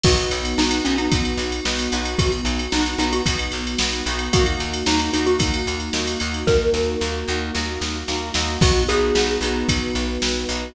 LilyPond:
<<
  \new Staff \with { instrumentName = "Xylophone" } { \time 4/4 \key b \major \tempo 4 = 112 fis'16 r8. dis'8 cis'16 dis'16 r2 | fis'16 r8. dis'8 dis'16 fis'16 r2 | fis'16 r8. dis'8 dis'16 fis'16 r2 | ais'2. r4 |
fis'8 gis'4. r2 | }
  \new Staff \with { instrumentName = "Electric Piano 1" } { \time 4/4 \key b \major <b dis' fis'>1~ | <b dis' fis'>1 | <ais dis' fis'>1~ | <ais dis' fis'>1 |
<b dis' fis'>1 | }
  \new Staff \with { instrumentName = "Pizzicato Strings" } { \time 4/4 \key b \major <b dis' fis'>4 <b dis' fis'>8 <b dis' fis'>8 <b dis' fis'>4 <b dis' fis'>8 <b dis' fis'>8~ | <b dis' fis'>4 <b dis' fis'>8 <b dis' fis'>8 <b dis' fis'>4 <b dis' fis'>8 <b dis' fis'>8 | <ais dis' fis'>4 <ais dis' fis'>8 <ais dis' fis'>8 <ais dis' fis'>4 <ais dis' fis'>8 <ais dis' fis'>8~ | <ais dis' fis'>4 <ais dis' fis'>8 <ais dis' fis'>8 <ais dis' fis'>4 <ais dis' fis'>8 <ais dis' fis'>8 |
<b dis' fis'>8 <b dis' fis'>8 <b dis' fis'>8 <b dis' fis'>2 <b dis' fis'>8 | }
  \new Staff \with { instrumentName = "Electric Bass (finger)" } { \clef bass \time 4/4 \key b \major b,,8 b,,8 b,,8 b,,8 b,,8 b,,8 b,,8 b,,8 | b,,8 b,,8 b,,8 b,,8 b,,8 b,,8 b,,8 b,,8 | dis,8 dis,8 dis,8 dis,8 dis,8 dis,8 dis,8 dis,8 | dis,8 dis,8 dis,8 dis,8 dis,8 dis,8 dis,8 dis,8 |
b,,8 b,,8 b,,8 b,,8 b,,8 b,,8 b,,8 b,,8 | }
  \new Staff \with { instrumentName = "Pad 2 (warm)" } { \time 4/4 \key b \major <b dis' fis'>1~ | <b dis' fis'>1 | <ais dis' fis'>1~ | <ais dis' fis'>1 |
<b dis' fis'>2 <b fis' b'>2 | }
  \new DrumStaff \with { instrumentName = "Drums" } \drummode { \time 4/4 <cymc bd>16 cymr16 cymr16 cymr16 sn16 cymr16 cymr16 cymr16 <bd cymr>16 cymr16 cymr16 cymr16 sn16 cymr16 cymr16 cymr16 | <bd cymr>16 cymr16 cymr16 cymr16 sn16 cymr16 cymr16 cymr16 <bd cymr>16 cymr16 cymr16 cymr16 sn16 cymr16 cymr16 cymr16 | <bd cymr>16 cymr16 cymr16 cymr16 sn16 cymr16 cymr16 cymr16 <bd cymr>16 cymr16 cymr16 cymr16 sn16 cymr16 cymr16 cymr16 | <bd sn>8 sn8 sn4 sn8 sn8 sn8 sn8 |
<cymc bd>8 cymr8 sn8 cymr8 <bd cymr>8 cymr8 sn8 cymr8 | }
>>